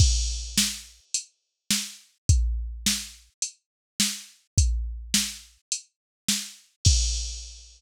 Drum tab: CC |x-------|--------|--------|x-------|
HH |----x---|x---x---|x---x---|--------|
SD |--o---o-|--o---o-|--o---o-|--------|
BD |o-------|o-------|o-------|o-------|